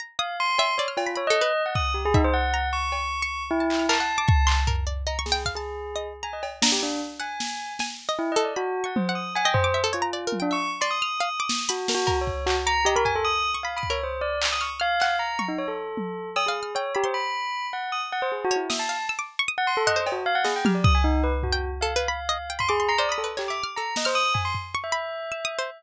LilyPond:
<<
  \new Staff \with { instrumentName = "Tubular Bells" } { \time 6/4 \tempo 4 = 154 r8 f''8 c'''4 cis''16 r16 f'8 cis''16 dis''4 fis''16 dis'''8 g'16 gis'16 dis'16 c''16 | fis''4 cis'''2 e'4 a''2 | r4 ais''16 r16 gis'8 r16 gis'4. r16 gis''16 dis''16 r8 d'16 g'16 d'8 | r8 gis''4. r4 \tuplet 3/2 { e'8 dis''8 d''8 } fis'8. fis''16 c''8 dis'''8 |
gis''16 g''16 c''8. r16 f'4~ f'16 d'16 cis'''8 r16 c'''16 dis'''2 | \tuplet 3/2 { fis'4 fis'4 cis''4 } fis'16 r16 ais''8 g'16 ais'16 gis''16 a'16 dis'''8. r16 \tuplet 3/2 { f''8 b''8 cis''8 } | c''8 d''8 r16 dis'''16 cis'''16 r16 f''4 ais''8. dis'16 cis''16 a'4.~ a'16 | dis'''16 gis'8. cis''8 g'16 c''16 b''4. fis''8 dis'''16 r16 fis''16 c''16 \tuplet 3/2 { gis'8 fis'8 e'8 } |
e''16 a''8. r4 r16 fis''16 c'''16 a'16 \tuplet 3/2 { dis''8 c''8 fis'8 } f''16 fis''16 gis'16 g''16 g'16 d''16 dis'''16 gis''16 | dis'8 b'16 r16 fis'8. r16 f''2 c'''16 gis'8 ais''16 d''16 dis'''16 a'16 r16 | g'16 d'''8 r16 ais''8 dis''16 c''16 dis'''8 gis''16 c'''16 r8. e''2~ e''16 | }
  \new Staff \with { instrumentName = "Harpsichord" } { \time 6/4 ais''8 dis'''4 e''8 d''16 f'''8 b''16 \tuplet 3/2 { b''8 a'8 b'8 } r4. e''8 | r8 ais''4. r16 cis'''8. r16 a''8 f'''16 ais'16 fis''8 d'''16 cis'''8 c'''8 | ais'8 d''8 \tuplet 3/2 { dis''8 cis'''8 g''8 } f''16 a''4 dis''8 r16 ais''8 r8 ais''4 | r8 fis''4. gis''8. dis''8. a'8 \tuplet 3/2 { b''4 cis'''4 fis''4 } |
fis''16 dis''8 d'''16 e''16 a'16 cis''16 ais''16 \tuplet 3/2 { d''8 ais'8 g''8 } e''8 r16 d''8 f'''16 r16 f''16 r16 d'''8. | b''16 r16 ais'8 ais'8 r4 d'''8 dis''16 b''16 gis''8. r8 cis'''16 \tuplet 3/2 { b''8 dis'''8 ais'8 } | r4. f'''8 f'''8 fis''4 cis'''2~ cis'''8 | \tuplet 3/2 { e'''8 f''8 f'''8 } g''8 b''16 c'''4.~ c'''16 r2 cis''8 |
dis'''8 f''16 r16 e'''16 d'''8 cis'''16 dis'''4 fis''16 c''4 r16 dis''8 f'''4 | r4 r16 g''8. \tuplet 3/2 { a'8 b'8 b''8 } r16 dis''16 r16 g''16 b''16 d'''16 c'''16 c'''16 \tuplet 3/2 { c''8 b''8 b'8 } | \tuplet 3/2 { cis''8 e''8 f'''8 } a'8. f'''16 r4. cis'''8 b''4 \tuplet 3/2 { e'''8 dis'''8 c''8 } | }
  \new DrumStaff \with { instrumentName = "Drums" } \drummode { \time 6/4 r4 r8 cb8 r8 cb8 r4 r8 bd8 r8 bd8 | r4 r8 cb8 r4 r8 hc8 hc4 bd8 hc8 | tomfh4 r8 sn8 bd4 r4 r8 cb8 sn4 | r4 sn4 sn4 r4 r4 tommh4 |
cb8 tomfh8 r4 r8 tommh8 r4 r4 r8 sn8 | hh8 sn8 bd8 bd8 hc4 r8 tomfh8 r4 r8 bd8 | r4 hc4 r8 hc8 r8 tommh8 r4 tommh4 | cb4 r4 r4 r4 r4 r4 |
sn4 r4 r4 tomfh8 cb8 r8 sn8 tommh8 bd8 | r4 tomfh4 r4 r4 tomfh4 r8 cb8 | hc4 r8 sn8 r8 tomfh8 tomfh4 r4 r4 | }
>>